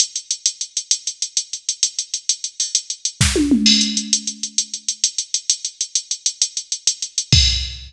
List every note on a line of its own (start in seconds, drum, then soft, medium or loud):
0.00 closed hi-hat medium
0.16 closed hi-hat medium
0.31 closed hi-hat medium
0.46 closed hi-hat medium
0.61 closed hi-hat medium
0.77 closed hi-hat medium
0.91 closed hi-hat medium
1.07 closed hi-hat medium
1.22 closed hi-hat medium
1.37 closed hi-hat medium
1.53 closed hi-hat medium
1.69 closed hi-hat medium
1.83 closed hi-hat medium
1.99 closed hi-hat medium
2.14 closed hi-hat medium
2.29 closed hi-hat medium
2.44 closed hi-hat medium
2.60 open hi-hat medium
2.75 closed hi-hat medium
2.90 closed hi-hat medium
3.05 closed hi-hat medium
3.21 kick medium
3.21 snare medium
3.36 high tom medium
3.51 mid tom medium
3.66 crash medium
3.81 closed hi-hat medium
3.97 closed hi-hat medium
4.13 closed hi-hat loud
4.27 closed hi-hat medium
4.43 closed hi-hat medium
4.58 closed hi-hat medium
4.74 closed hi-hat medium
4.88 closed hi-hat medium
5.04 closed hi-hat medium
5.18 closed hi-hat medium
5.34 closed hi-hat medium
5.50 closed hi-hat medium
5.65 closed hi-hat medium
5.81 closed hi-hat medium
5.95 closed hi-hat medium
6.11 closed hi-hat medium
6.26 closed hi-hat medium
6.42 closed hi-hat medium
6.57 closed hi-hat medium
6.72 closed hi-hat medium
6.87 closed hi-hat medium
7.02 closed hi-hat medium
7.18 closed hi-hat medium
7.32 kick loud
7.32 crash loud